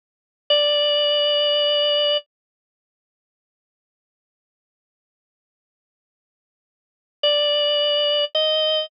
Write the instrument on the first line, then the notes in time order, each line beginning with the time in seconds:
drawbar organ
0.50 D5
7.23 D5
8.35 D#5